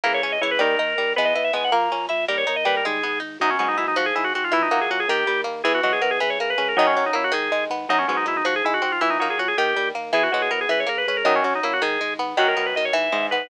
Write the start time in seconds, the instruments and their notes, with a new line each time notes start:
0.04 drawbar organ C#2 A#4, harpsichord E3 A#3 E4
0.14 drawbar organ C#5
0.22 drawbar organ C#2 C#5, harpsichord C#4
0.32 drawbar organ D#5
0.41 drawbar organ C#2 C#5, harpsichord E3 E4
0.51 drawbar organ B4
0.59 drawbar organ D#2 A#4, harpsichord D#3 G3 D#4
0.79 drawbar organ D#2, harpsichord D#4
0.98 drawbar organ D#2, harpsichord G3
1.16 drawbar organ E2 B4, harpsichord G#3 B3 B4
1.25 drawbar organ D#5
1.35 drawbar organ E2 D#5, harpsichord E4
1.44 drawbar organ E5
1.53 drawbar organ E2 G#5, harpsichord G#3 B3 B4
1.64 drawbar organ F#5
1.72 drawbar organ A#1 A#5, harpsichord A#3 A#4
1.92 drawbar organ A#1, harpsichord C#4
2.09 drawbar organ A#1 E5, harpsichord E4
2.28 drawbar organ D#2 A#4, harpsichord G3 G4
2.38 drawbar organ C#5
2.47 drawbar organ D#2 C#5, harpsichord D#4
2.56 drawbar organ D#5
2.65 drawbar organ D#2 B4, harpsichord G3 G4
2.77 drawbar organ A#4
2.85 drawbar organ G#1 G#4, harpsichord G#3
3.03 drawbar organ G#1, harpsichord B3
3.20 drawbar organ G#1, harpsichord D#4
3.40 drawbar organ B1 D#4, harpsichord F#2 F#3
3.50 drawbar organ C#4
3.59 drawbar organ B1 C#4, harpsichord G#2 G#3 B3
3.68 drawbar organ D#4
3.77 drawbar organ B1 E4, harpsichord D#4
3.88 drawbar organ D#4
3.96 drawbar organ G#1 F#4, harpsichord F3
4.06 drawbar organ G#4
4.15 drawbar organ G#1 E4, harpsichord G#3
4.24 drawbar organ F#4
4.35 drawbar organ G#1 F#4, harpsichord C4
4.44 drawbar organ F4
4.52 drawbar organ A#1 E4, harpsichord E3 E4
4.62 drawbar organ D#4
4.71 drawbar organ A#1 D#4, harpsichord F#3 A#3 F#4
4.81 drawbar organ G#4
4.90 drawbar organ A#1 F#4, harpsichord C#4
5.00 drawbar organ G#4
5.08 drawbar organ D#2 G4, harpsichord D#3
5.27 drawbar organ D#2, harpsichord G3
5.44 drawbar organ D#2, harpsichord A#3
5.64 drawbar organ E2 G#4, harpsichord E3 E4
5.74 drawbar organ F#4
5.83 drawbar organ E2 F#4, harpsichord F#3 G#3 F#4
5.92 drawbar organ G#4
6.02 drawbar organ E2 A#4, harpsichord B3
6.11 drawbar organ G#4
6.20 drawbar organ C#2 B4, harpsichord E3
6.30 drawbar organ C#5
6.38 drawbar organ C#2 A#4, harpsichord A#3
6.50 drawbar organ B4
6.58 drawbar organ C#2 B4, harpsichord C#4
6.68 drawbar organ A#4
6.77 harpsichord F#2 D#3 F#3, drawbar organ F#2 D#4
6.87 drawbar organ C#4
6.96 drawbar organ F#2 C#4, harpsichord F#3
7.06 drawbar organ D#4
7.13 drawbar organ F#2 E4, harpsichord A#3
7.24 drawbar organ F#4
7.32 drawbar organ G#1 G#4, harpsichord D#3
7.51 drawbar organ G#1, harpsichord G#3
7.70 drawbar organ G#1, harpsichord B3
7.89 drawbar organ B1 D#4, harpsichord F#2 F#3
7.99 drawbar organ C#4
8.08 drawbar organ B1 C#4, harpsichord G#2 G#3 B3
8.17 drawbar organ D#4
8.26 drawbar organ B1 E4, harpsichord D#4
8.37 drawbar organ D#4
8.45 drawbar organ G#1 F#4, harpsichord F3
8.56 drawbar organ G#4
8.63 drawbar organ G#1 E4, harpsichord G#3
8.74 drawbar organ F#4
8.82 drawbar organ G#1 F#4, harpsichord C4
8.92 drawbar organ F4
9.01 drawbar organ A#1 E4, harpsichord E3 E4
9.10 drawbar organ D#4
9.19 drawbar organ A#1 D#4, harpsichord F#3 A#3 F#4
9.30 drawbar organ G#4
9.38 drawbar organ A#1 F#4, harpsichord C#4
9.48 drawbar organ G#4
9.57 drawbar organ D#2 G4, harpsichord D#3
9.76 drawbar organ D#2, harpsichord G3
9.95 drawbar organ D#2, harpsichord A#3
10.12 drawbar organ E2 G#4, harpsichord E3 E4
10.23 drawbar organ F#4
10.32 drawbar organ E2 F#4, harpsichord F#3 G#3 F#4
10.42 drawbar organ G#4
10.50 drawbar organ E2 A#4, harpsichord B3
10.61 drawbar organ G#4
10.69 drawbar organ C#2 B4, harpsichord E3
10.80 drawbar organ C#5
10.87 drawbar organ C#2 A#4, harpsichord A#3
10.98 drawbar organ B4
11.07 drawbar organ C#2 B4, harpsichord C#4
11.17 drawbar organ A#4
11.24 drawbar organ F#2 D#4, harpsichord F#2 D#3 F#3
11.36 drawbar organ C#4
11.44 drawbar organ F#2 C#4, harpsichord F#3
11.55 drawbar organ D#4
11.63 drawbar organ F#2 E4, harpsichord A#3
11.73 drawbar organ F#4
11.82 drawbar organ G#1 G#4, harpsichord D#3
12.01 drawbar organ G#1, harpsichord G#3
12.18 drawbar organ G#1, harpsichord B3
12.37 drawbar organ B1 F#4, harpsichord F#2 D#3 F#3
12.48 drawbar organ A#4
12.57 drawbar organ B1 A#4, harpsichord B3
12.66 drawbar organ B4
12.75 drawbar organ B1 D#5, harpsichord D#3
12.85 drawbar organ C#5
12.93 drawbar organ G#1 E5, harpsichord E3
13.12 drawbar organ G#1, harpsichord G#2 G#3
13.31 drawbar organ G#1 B4, harpsichord B3